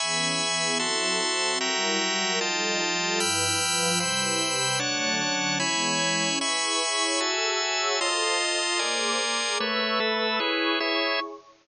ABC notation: X:1
M:2/2
L:1/8
Q:1/2=75
K:Emix
V:1 name="Pad 2 (warm)"
[E,B,CG]2 [E,B,EG]2 [F,=CEA]2 [F,CFA]2 | [F,=G,E^A]2 [F,G,FA]2 [=F,G,_E=A]2 [F,G,=FA]2 | [=G,,=F,EB]2 [G,,F,=FB]2 [=C,=G,EB]2 [C,G,=GB]2 | [D,F,A,c]2 [D,F,Cc]2 [E,G,B,c]2 [E,G,Cc]2 |
[EGBc']2 [EGcc']2 [FGAe']2 [FGce']2 | [=FA=c_e']2 [FA_ee']2 [_B,_Acd']2 [B,A_Bd']2 | [ABc'e']2 [ABbe']2 [EGBc']2 [EGcc']2 |]
V:2 name="Drawbar Organ"
[egbc']4 [Fea=c']4 | [Fe=g^a]4 [=F_eg=a]4 | [=gbe'=f']4 [=cgbe']4 | [Dcfa]4 [Ecgb]4 |
[egbc']4 [Fega]4 | [=F_ea=c']4 [_Bd_ac']4 | [A,Bce]2 [A,ABe]2 [EGBc]2 [EGce]2 |]